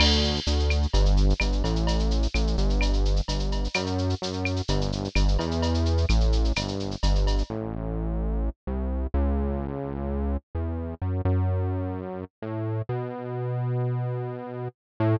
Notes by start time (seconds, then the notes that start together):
0.00 D2, crash, cowbell, claves
0.11 shaker
0.24 shaker
0.36 shaker
0.47 D2, shaker
0.60 shaker
0.70 claves, shaker
0.82 shaker
0.93 G1, cowbell, shaker
1.06 shaker
1.17 shaker
1.30 shaker
1.40 G1, cowbell, claves, shaker
1.52 shaker
1.64 A1, cowbell, shaker
1.76 shaker
1.87 cowbell, shaker
1.99 shaker
2.11 shaker
2.23 shaker
2.34 A1, claves, shaker
2.47 shaker
2.58 G1, shaker
2.70 shaker
2.81 cowbell, claves, shaker
2.93 shaker
3.05 shaker
3.16 shaker
3.28 G1, cowbell, shaker
3.39 shaker
3.52 cowbell, shaker
3.64 shaker
3.74 F#2, cowbell, claves, shaker
3.86 shaker
3.98 shaker
4.10 shaker
4.22 F#2, shaker
4.33 shaker
4.45 claves, shaker
4.56 shaker
4.68 G1, cowbell, shaker
4.81 shaker
4.92 shaker
5.04 shaker
5.15 G1, cowbell, claves, shaker
5.28 shaker
5.39 E2, cowbell, shaker
5.51 shaker
5.62 cowbell, shaker
5.74 shaker
5.85 shaker
5.97 shaker
6.09 A1, claves, shaker
6.20 shaker
6.32 shaker
6.45 shaker
6.56 G1, cowbell, claves, shaker
6.68 shaker
6.80 shaker
6.91 shaker
7.03 G1, cowbell, shaker
7.15 shaker
7.27 cowbell, shaker
7.38 shaker
7.50 A1
8.67 C2
9.14 C#2
10.55 E2
11.02 F#2
11.25 F#2
12.42 A2
12.89 B2
15.00 A2